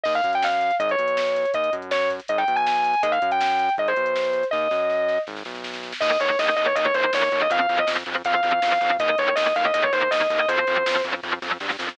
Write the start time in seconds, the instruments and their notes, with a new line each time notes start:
0.04 synth bass 1 D#2, distortion guitar D#5, kick, crash
0.15 distortion guitar F5, closed hi-hat
0.24 synth bass 1 F#2, kick, closed hi-hat
0.33 distortion guitar G5, closed hi-hat
0.42 distortion guitar F5, snare
0.52 closed hi-hat
0.61 closed hi-hat
0.71 closed hi-hat
0.80 synth bass 1 G#1, distortion guitar D#5, kick, closed hi-hat
0.89 distortion guitar C#5, closed hi-hat
0.98 synth bass 1 B1, closed hi-hat
1.08 closed hi-hat
1.17 snare
1.26 closed hi-hat
1.36 closed hi-hat
1.45 closed hi-hat
1.54 synth bass 1 D#2, distortion guitar D#5, kick, closed hi-hat
1.64 closed hi-hat
1.73 synth bass 1 F#2, kick, closed hi-hat
1.82 closed hi-hat
1.91 distortion guitar C#5, snare
2.01 closed hi-hat
2.10 kick, closed hi-hat
2.20 closed hi-hat
2.28 synth bass 1 G#1, distortion guitar D#5, kick, closed hi-hat
2.38 distortion guitar G5, closed hi-hat
2.48 synth bass 1 B1, closed hi-hat
2.56 distortion guitar G#5, closed hi-hat
2.67 distortion guitar G#5, snare
2.76 closed hi-hat
2.84 closed hi-hat
2.94 closed hi-hat
3.03 synth bass 1 D#2, distortion guitar D#5, kick, closed hi-hat
3.12 distortion guitar F5, closed hi-hat
3.22 synth bass 1 F#2, kick, closed hi-hat
3.31 distortion guitar G5, closed hi-hat
3.41 distortion guitar G5, snare
3.50 closed hi-hat
3.59 closed hi-hat
3.69 closed hi-hat
3.78 synth bass 1 G#1, distortion guitar D#5, kick, closed hi-hat
3.88 distortion guitar C5, closed hi-hat
3.97 synth bass 1 B1, closed hi-hat
4.06 closed hi-hat
4.16 snare
4.24 closed hi-hat
4.33 closed hi-hat
4.43 closed hi-hat
4.51 synth bass 1 D#2, distortion guitar D#5, kick, snare
4.71 synth bass 1 F#2, snare
4.90 snare
5.09 snare
5.27 synth bass 1 G#1, snare
5.36 snare
5.45 synth bass 1 B1, snare
5.55 snare
5.64 snare
5.73 snare
5.83 snare
5.93 snare
6.01 synth bass 1 D#2, overdriven guitar D#3 A#3, distortion guitar D#5, kick, crash
6.20 synth bass 1 D#2, overdriven guitar D#3 A#3, distortion guitar C#5, closed hi-hat
6.39 synth bass 1 D#2, overdriven guitar D#3 A#3, distortion guitar D#5, snare
6.57 synth bass 1 D#2, overdriven guitar D#3 A#3, distortion guitar D#5, closed hi-hat
6.66 distortion guitar C#5
6.75 synth bass 1 D#2, overdriven guitar D#3 A#3, distortion guitar D#5, kick, closed hi-hat
6.85 distortion guitar C#5
6.94 synth bass 1 D#2, overdriven guitar D#3 A#3, distortion guitar C5, kick, closed hi-hat
7.13 synth bass 1 D#2, overdriven guitar D#3 A#3, distortion guitar C#5, snare
7.32 synth bass 1 D#2, overdriven guitar D#3 A#3, kick, closed hi-hat
7.42 distortion guitar D#5
7.50 synth bass 1 F2, overdriven guitar F3 C4, distortion guitar F5, kick, closed hi-hat
7.61 distortion guitar F5
7.69 synth bass 1 F2, overdriven guitar F3 C4, closed hi-hat
7.79 distortion guitar D#5
7.87 synth bass 1 F2, overdriven guitar F3 C4, snare
8.06 synth bass 1 F2, overdriven guitar F3 C4, closed hi-hat
8.25 synth bass 1 F2, overdriven guitar F3 C4, distortion guitar F5, kick, closed hi-hat
8.35 distortion guitar F5
8.43 synth bass 1 F2, overdriven guitar F3 C4, kick, closed hi-hat
8.62 synth bass 1 F2, overdriven guitar F3 C4, snare
8.81 synth bass 1 F2, overdriven guitar F3 C4, kick, closed hi-hat
8.99 synth bass 1 D#2, overdriven guitar D#3 A#3, distortion guitar D#5, kick, closed hi-hat
9.18 synth bass 1 D#2, overdriven guitar D#3 A#3, distortion guitar C#5, closed hi-hat
9.36 synth bass 1 D#2, overdriven guitar D#3 A#3, distortion guitar D#5, snare
9.56 synth bass 1 D#2, overdriven guitar D#3 A#3, distortion guitar F5, closed hi-hat
9.65 distortion guitar D#5
9.74 synth bass 1 D#2, overdriven guitar D#3 A#3, distortion guitar D#5, kick, closed hi-hat
9.83 distortion guitar C#5
9.93 synth bass 1 D#2, overdriven guitar D#3 A#3, distortion guitar C5, closed hi-hat
10.11 synth bass 1 D#2, overdriven guitar D#3 A#3, distortion guitar D#5, snare
10.30 synth bass 1 D#2, overdriven guitar D#3 A#3, kick, closed hi-hat
10.39 distortion guitar D#5
10.48 synth bass 1 F2, overdriven guitar F3 C4, distortion guitar C5, kick, closed hi-hat
10.67 synth bass 1 F2, overdriven guitar F3 C4, closed hi-hat
10.86 synth bass 1 F2, overdriven guitar F3 C4, snare, closed hi-hat
11.04 synth bass 1 F2, overdriven guitar F3 C4, closed hi-hat
11.23 synth bass 1 F2, overdriven guitar F3 C4, kick, snare
11.42 synth bass 1 F2, overdriven guitar F3 C4, snare
11.60 synth bass 1 G2, overdriven guitar F3 C4, snare
11.70 snare
11.79 synth bass 1 F2, overdriven guitar F3 C4, snare
11.89 snare